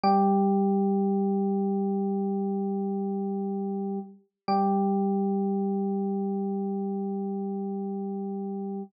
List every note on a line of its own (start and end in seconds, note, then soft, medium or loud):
0.04 3.99 G3 medium
0.04 3.99 G4 medium
4.48 8.83 G3 medium
4.48 8.83 G4 medium